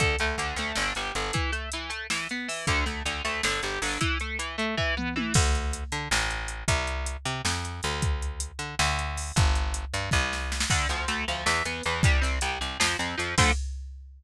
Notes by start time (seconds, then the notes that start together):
0.00 D2 D3, kick, closed hi-hat
0.19 D2 A3, closed hi-hat
0.38 D2 D3, closed hi-hat
0.56 D2 A3, closed hi-hat
0.75 G1 D3, snare
0.95 G1 G3, closed hi-hat
1.15 G1 D3, closed hi-hat
1.33 E3, kick, closed hi-hat
1.52 A3, closed hi-hat
1.72 E3, closed hi-hat
1.90 A3, closed hi-hat
2.10 E3, snare
2.29 B3, closed hi-hat
2.48 E3, open hi-hat
2.67 D2 D3, kick, closed hi-hat
2.86 D2 A3, closed hi-hat
3.05 D2 D3, closed hi-hat
3.25 D2 A3, closed hi-hat
3.43 G1 D3, snare
3.63 G1 G3, closed hi-hat
3.82 G1 D3, open hi-hat
4.01 E3, kick, closed hi-hat
4.20 A3, closed hi-hat
4.39 E3, closed hi-hat
4.58 A3, closed hi-hat
4.77 E3, kick
4.97 B3, mid tom
5.16 E3, high tom
5.34 D2, kick, crash
5.55 closed hi-hat
5.73 closed hi-hat
5.92 D3, closed hi-hat
6.11 A1, snare
6.30 closed hi-hat
6.48 closed hi-hat
6.68 C2, kick, closed hi-hat
6.87 closed hi-hat
7.06 closed hi-hat
7.25 C3, closed hi-hat
7.45 F2, snare
7.65 closed hi-hat
7.83 D2, closed hi-hat
8.02 kick, closed hi-hat
8.22 closed hi-hat
8.40 closed hi-hat
8.59 D3, closed hi-hat
8.79 D2, snare
8.99 closed hi-hat
9.17 open hi-hat
9.36 G1, kick, closed hi-hat
9.55 closed hi-hat
9.74 closed hi-hat
9.94 G2, closed hi-hat
10.11 C2, kick, snare
10.33 snare
10.52 snare
10.60 snare
10.70 D2 D3, kick, crash
10.89 D2 F3, closed hi-hat
11.08 D2 A3, closed hi-hat
11.28 D2 F3, closed hi-hat
11.46 E2 E3, snare
11.65 E2 B3, closed hi-hat
11.83 E2 E3, closed hi-hat
12.03 C2 G3, kick, closed hi-hat
12.21 C2 C4, closed hi-hat
12.41 C2 G3, closed hi-hat
12.61 C2 C4, closed hi-hat
12.80 F2 F3, snare
12.99 F2 C4, closed hi-hat
13.18 F2 F3, closed hi-hat
13.38 D2 D3 F3 A3, kick, crash